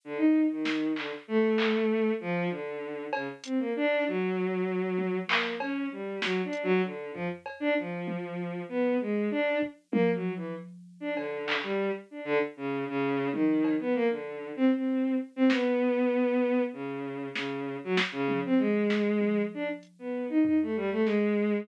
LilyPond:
<<
  \new Staff \with { instrumentName = "Violin" } { \time 5/4 \tempo 4 = 97 d16 dis'8 dis8. d16 r16 a4. f8 d4 | cis16 r16 c'16 ais16 d'8 fis2 ais8 cis'8 g8 | \tuplet 3/2 { fis8 d'8 fis8 } d8 f16 r8 d'16 f4. b8 gis8 | d'8 r8 \tuplet 3/2 { ais8 fis8 e8 } r8. d'16 d8. g8 r16 d'16 d16 |
r16 cis8 cis8. dis8. b16 ais16 d8. c'16 c'8. r16 c'16 | b2 cis4 cis8. fis16 r16 cis8 c'16 | gis4. d'16 r8 b8 dis'16 dis'16 a16 g16 a16 gis4 | }
  \new DrumStaff \with { instrumentName = "Drums" } \drummode { \time 5/4 r4 sn8 hc8 r8 hc8 r4 r4 | cb8 hh8 r4 r4 tommh8 hc8 cb4 | sn8 hh8 r8 tomfh8 cb4 tommh4 r4 | r8 bd8 tommh4 r4 cb8 hc8 r4 |
r4 r8 tommh8 cb4 r4 r4 | sn4 r4 r4 sn4 sn8 tommh8 | r8 sn8 tommh4 hh4 tomfh4 sn4 | }
>>